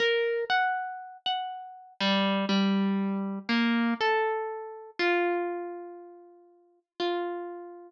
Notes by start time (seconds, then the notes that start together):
0.00 A#4
0.50 F#5
1.26 F#5
2.00 G3
2.49 G3
3.49 A#3
4.01 A4
4.99 F4
7.00 F4